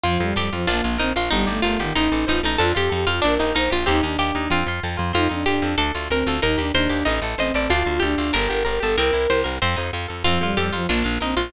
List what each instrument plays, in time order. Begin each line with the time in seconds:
0.04 electric bass (finger) F2, violin F3, acoustic guitar (steel) C4, harpsichord F4
0.20 electric bass (finger) F2, violin G3, acoustic guitar (steel) F4
0.36 electric bass (finger) F2, violin G3, harpsichord G4, acoustic guitar (steel) A4
0.53 electric bass (finger) F2, violin F3, acoustic guitar (steel) F4
0.67 electric bass (finger) A#1, violin A#3, acoustic guitar (steel) D4, harpsichord F4
0.84 electric bass (finger) A#1, acoustic guitar (steel) F4
0.98 electric bass (finger) A#1, violin C4, harpsichord D#4, acoustic guitar (steel) A#4
1.16 electric bass (finger) A#1, acoustic guitar (steel) F4, harpsichord F4
1.31 electric bass (finger) G1, violin G3, harpsichord D#4, acoustic guitar (steel) D#4
1.47 electric bass (finger) G1, violin A3, acoustic guitar (steel) G4
1.62 electric bass (finger) G1, violin A3, harpsichord F4, acoustic guitar (steel) A#4
1.79 electric bass (finger) G1, violin D#3, acoustic guitar (steel) G4
1.95 electric bass (finger) A1, violin D#4, harpsichord D#4, acoustic guitar (steel) D#4
2.12 electric bass (finger) A1, acoustic guitar (steel) A4
2.27 electric bass (finger) A1, harpsichord D#4, violin F4, acoustic guitar (steel) C5
2.43 electric bass (finger) A1, harpsichord D#4, acoustic guitar (steel) A4
2.58 electric bass (finger) F2, acoustic guitar (steel) D4, violin F4, harpsichord A4
2.75 electric bass (finger) F2, acoustic guitar (steel) F4, harpsichord G4, violin G4
2.90 electric bass (finger) F2, violin G4, acoustic guitar (steel) A4
3.07 electric bass (finger) F2, harpsichord F4, violin F4, acoustic guitar (steel) F4
3.22 electric bass (finger) A#1, harpsichord D4, acoustic guitar (steel) D4, violin A#4
3.39 electric bass (finger) A#1, harpsichord D#4, acoustic guitar (steel) G4
3.55 electric bass (finger) A#1, harpsichord D#4, acoustic guitar (steel) A#4, violin C5
3.70 electric bass (finger) A#1, harpsichord F4, acoustic guitar (steel) G4
3.86 electric bass (finger) D#2, acoustic guitar (steel) C4, violin D#4, harpsichord G4
4.03 electric bass (finger) D#2, violin D4, acoustic guitar (steel) D#4
4.18 electric bass (finger) D#2, harpsichord G4, acoustic guitar (steel) G4
4.35 electric bass (finger) D#2, acoustic guitar (steel) D#4
4.50 electric bass (finger) F2, acoustic guitar (steel) C4, harpsichord F4
4.66 electric bass (finger) F2, acoustic guitar (steel) F4
4.83 electric bass (finger) F2, acoustic guitar (steel) A4
4.97 electric bass (finger) F2, acoustic guitar (steel) F4
5.13 electric bass (finger) F2, acoustic guitar (steel) C4, violin D#4, harpsichord F4
5.29 electric bass (finger) F2, violin D4, acoustic guitar (steel) D#4
5.46 electric bass (finger) F2, violin D4, acoustic guitar (steel) F4, harpsichord G4
5.62 electric bass (finger) F2, acoustic guitar (steel) A4
5.78 electric bass (finger) D2, acoustic guitar (steel) D4, harpsichord A4
5.95 electric bass (finger) D2, acoustic guitar (steel) F4
6.10 electric bass (finger) D2, violin C4, acoustic guitar (steel) A#4, harpsichord A#4
6.27 electric bass (finger) D2, acoustic guitar (steel) F4, harpsichord A4
6.42 electric bass (finger) D#2, acoustic guitar (steel) D#4, violin D#4, harpsichord A#4
6.58 electric bass (finger) D#2, violin D4, acoustic guitar (steel) G4
6.73 electric bass (finger) D#2, violin D4, acoustic guitar (steel) A#4, harpsichord C5
6.89 electric bass (finger) D#2, acoustic guitar (steel) G4
7.05 electric bass (finger) A1, acoustic guitar (steel) D#4, harpsichord D#5
7.22 electric bass (finger) A1, acoustic guitar (steel) A4
7.38 electric bass (finger) A1, violin C4, acoustic guitar (steel) C5, harpsichord D#5
7.54 electric bass (finger) A1, acoustic guitar (steel) A4, harpsichord D5
7.70 electric bass (finger) D2, acoustic guitar (steel) D4, harpsichord F4, violin F4
7.85 electric bass (finger) D2, acoustic guitar (steel) F4
8.00 electric bass (finger) D2, violin D4, harpsichord G4, acoustic guitar (steel) A4
8.18 electric bass (finger) D2, acoustic guitar (steel) F4
8.33 electric bass (finger) G1, acoustic guitar (steel) D4, harpsichord A#4, violin A#4
8.49 electric bass (finger) G1, acoustic guitar (steel) G4, violin A#4
8.65 electric bass (finger) G1, acoustic guitar (steel) A#4, harpsichord A#4, violin A#4
8.80 electric bass (finger) G1, acoustic guitar (steel) G4, violin A4, harpsichord A4
8.96 electric bass (finger) C2, acoustic guitar (steel) C4, violin A#4, harpsichord A#4
9.13 electric bass (finger) C2, acoustic guitar (steel) E4
9.30 electric bass (finger) C2, acoustic guitar (steel) G4, harpsichord C5
9.44 electric bass (finger) C2, acoustic guitar (steel) A#4
9.62 electric bass (finger) F2, acoustic guitar (steel) C4, harpsichord C5
9.76 electric bass (finger) F2, acoustic guitar (steel) D#4
9.93 electric bass (finger) F2, acoustic guitar (steel) F4
10.08 electric bass (finger) F2, acoustic guitar (steel) A4
10.24 electric bass (finger) F2, violin F3, acoustic guitar (steel) C4, harpsichord F4
10.41 electric bass (finger) F2, violin G3, acoustic guitar (steel) F4
10.57 electric bass (finger) F2, violin G3, harpsichord G4, acoustic guitar (steel) A4
10.72 electric bass (finger) F2, violin F3, acoustic guitar (steel) F4
10.89 electric bass (finger) A#1, violin A#3, acoustic guitar (steel) D4, harpsichord F4
11.04 electric bass (finger) A#1, acoustic guitar (steel) F4
11.21 electric bass (finger) A#1, violin C4, harpsichord D#4, acoustic guitar (steel) A#4
11.37 electric bass (finger) A#1, harpsichord F4, acoustic guitar (steel) F4